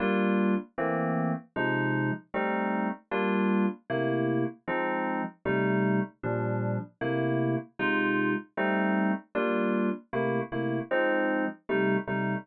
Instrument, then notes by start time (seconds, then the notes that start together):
electric piano 2
0.00 G3 A#3 D4 F4
0.78 E3 A3 A#3 C4
1.56 C3 F3 G#3 D#4
2.34 G3 A3 C4 D#4
3.11 G3 A#3 D4 F4
3.90 C3 A3 A#3 E4
4.68 F3 G#3 C4 D#4
5.45 C3 G3 A3 D#4
6.23 A#2 F3 G3 D4
7.01 C3 A3 A#3 E4
7.79 C3 G#3 D#4 F4
8.57 G3 A3 C4 D#4
9.35 G3 A#3 D4 F4
10.13 C3 A3 A#3 E4
10.52 C3 A3 A#3 E4
10.91 F3 G#3 C4 D#4
11.69 C3 G3 A3 D#4
12.07 C3 G3 A3 D#4